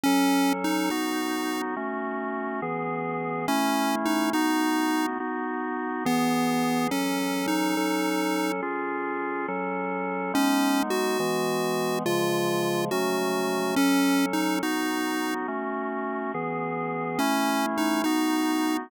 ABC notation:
X:1
M:6/8
L:1/8
Q:3/8=70
K:F#dor
V:1 name="Lead 1 (square)"
C2 D D3 | z6 | C2 D D3 | z3 B,3 |
C2 D4 | z6 | C2 F4 | ^E3 F3 |
C2 D D3 | z6 | C2 D D3 |]
V:2 name="Drawbar Organ"
[F,CA]3 [B,DF]3 | [A,CF]3 [E,B,G]3 | [A,CE]3 [B,DF]3 | [B,DF]3 [E,B,G]3 |
[F,CA]3 [F,CA]3 | [C^EG]3 [F,CA]3 | [G,B,D]3 [E,G,B,]3 | [C,^E,G,]3 [F,A,C]3 |
[F,CA]3 [B,DF]3 | [A,CF]3 [E,B,G]3 | [A,CE]3 [B,DF]3 |]